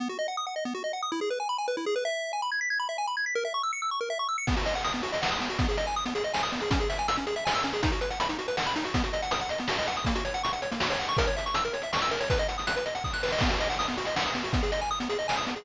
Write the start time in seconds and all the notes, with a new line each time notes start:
0.00 B3
0.09 F#4
0.19 D#5
0.28 F#5
0.37 D#6
0.47 F#5
0.56 D#5
0.65 B3
0.75 F#4
0.84 D#5
0.93 F#5
1.02 D#6
1.12 E4
1.21 G#4
1.30 B4
1.40 G#5
1.49 B5
1.58 G#5
1.68 B4
1.77 E4
1.86 G#4
1.96 B4
2.05 E5
2.33 G#5
2.42 B5
2.52 G#6
2.61 B6
2.70 G#6
2.80 B5
2.89 E5
2.98 G#5
3.07 B5
3.17 G#6
3.26 B6
3.35 A#4
3.45 E5
3.54 C#6
3.63 E6
3.73 C#7
3.82 E6
3.91 C#6
4.01 A#4
4.10 E5
4.19 C#6
4.29 E6
4.38 C#7
4.47 B3, kick, crash
4.57 F#4, closed hi-hat
4.65 D#5, closed hi-hat
4.74 F#5, closed hi-hat
4.84 D#6, closed hi-hat
4.92 B3, closed hi-hat
5.03 F#4, closed hi-hat
5.12 D#5, closed hi-hat
5.22 F#5, snare
5.31 D#6, closed hi-hat
5.40 B3, closed hi-hat
5.50 F#4, closed hi-hat
5.59 B3, kick, closed hi-hat
5.68 G#4, closed hi-hat
5.77 D#5, closed hi-hat
5.86 G#5, closed hi-hat
5.96 D#6
6.06 B3, closed hi-hat
6.15 G#4, closed hi-hat
6.24 D#5, closed hi-hat
6.34 G#5, snare
6.43 D#6, closed hi-hat
6.52 B3, closed hi-hat
6.60 G#4, closed hi-hat
6.71 C#4, kick, closed hi-hat
6.79 G#4, closed hi-hat
6.89 E5, closed hi-hat
6.98 G#5, closed hi-hat
7.08 E6, closed hi-hat
7.16 C#4, closed hi-hat
7.27 G#4, closed hi-hat
7.36 E5, closed hi-hat
7.45 G#5, snare
7.55 E6, closed hi-hat
7.63 C#4, closed hi-hat
7.72 G#4, closed hi-hat
7.83 D#4, kick, closed hi-hat
7.91 F#4, closed hi-hat
8.01 B4, closed hi-hat
8.10 F#5, closed hi-hat
8.20 B5, closed hi-hat
8.29 D#4, closed hi-hat
8.39 F#4, closed hi-hat
8.48 B4, closed hi-hat
8.57 F#5, snare
8.66 B5, closed hi-hat
8.75 D#4, closed hi-hat
8.84 F#4, closed hi-hat
8.94 B3, kick, closed hi-hat
9.04 F#4, closed hi-hat
9.13 D#5, closed hi-hat
9.22 F#5, closed hi-hat
9.31 D#6, closed hi-hat
9.39 F#5, closed hi-hat
9.49 D#5, closed hi-hat
9.58 B3, closed hi-hat
9.68 F#4, snare
9.78 D#5, closed hi-hat
9.87 F#5, closed hi-hat
9.96 D#6, closed hi-hat
10.05 A#3, kick, closed hi-hat
10.15 F#4, closed hi-hat
10.25 C#5, closed hi-hat
10.34 F#5, closed hi-hat
10.43 C#6, closed hi-hat
10.53 F#5, closed hi-hat
10.62 C#5, closed hi-hat
10.71 A#3, closed hi-hat
10.80 F#4, snare
10.90 C#5, closed hi-hat
10.99 F#5, closed hi-hat
11.08 C#6, closed hi-hat
11.17 A#4, kick, closed hi-hat
11.26 C#5, closed hi-hat
11.37 E5, closed hi-hat
11.46 C#6, closed hi-hat
11.54 E6, closed hi-hat
11.65 A#4, closed hi-hat
11.73 C#5, closed hi-hat
11.82 E5, closed hi-hat
11.93 C#6, snare
12.02 E6, closed hi-hat
12.11 A#4, closed hi-hat
12.20 C#5, closed hi-hat
12.30 B4, kick, closed hi-hat
12.38 D#5, closed hi-hat
12.48 F#5, closed hi-hat
12.58 D#6, closed hi-hat
12.67 F#6, closed hi-hat
12.76 B4, closed hi-hat
12.86 D#5, closed hi-hat
12.95 F#5, closed hi-hat
13.04 D#6, kick, snare
13.13 F#6, snare
13.23 B4, snare
13.28 snare
13.32 D#5, snare
13.39 B3, kick, snare, crash
13.50 F#4, closed hi-hat
13.60 D#5, closed hi-hat
13.70 F#5, closed hi-hat
13.79 D#6, closed hi-hat
13.88 B3, closed hi-hat
13.98 F#4, closed hi-hat
14.05 D#5, closed hi-hat
14.16 F#5, snare
14.25 D#6, closed hi-hat
14.35 B3, closed hi-hat
14.43 F#4, closed hi-hat
14.53 B3, kick, closed hi-hat
14.63 G#4, closed hi-hat
14.72 D#5, closed hi-hat
14.80 G#5, closed hi-hat
14.91 D#6
15.00 B3, closed hi-hat
15.09 G#4, closed hi-hat
15.19 D#5, closed hi-hat
15.28 G#5, snare
15.36 D#6, closed hi-hat
15.47 B3, closed hi-hat
15.56 G#4, closed hi-hat